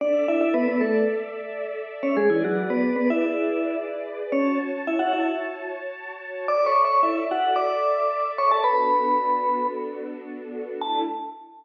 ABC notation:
X:1
M:4/4
L:1/16
Q:1/4=111
K:A
V:1 name="Vibraphone"
[Dd]2 [Ee] [Ee] [B,B] [B,B] [A,A]2 z7 [Cc] | [G,G] [E,E] [F,F]2 [B,B]2 [B,B] [Ee]5 z4 | [Cc]2 z2 [Ee] [Ff] [Ee]2 z8 | (3[dd']2 [cc']2 [cc']2 [Ee]2 [Ff]2 [dd']6 [cc'] [Aa] |
[Bb]8 z8 | a4 z12 |]
V:2 name="String Ensemble 1"
[Ade]16 | [GBd]16 | [Fca]16 | [Ade]16 |
[B,DFA]16 | [A,DE]4 z12 |]